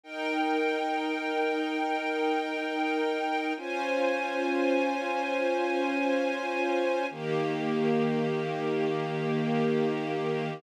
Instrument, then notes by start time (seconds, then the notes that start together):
string ensemble 1
0.03 D#4 A#4 G5
3.57 C#4 F4 C5 G#5
7.10 D#3 A#3 G4